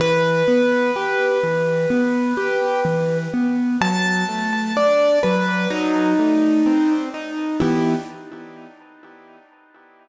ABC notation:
X:1
M:4/4
L:1/8
Q:1/4=63
K:Em
V:1 name="Acoustic Grand Piano"
B8 | a2 d B ^D3 z | E2 z6 |]
V:2 name="Acoustic Grand Piano"
E, B, G E, B, G E, B, | F, A, D F, F, A, C ^D | [E,B,G]2 z6 |]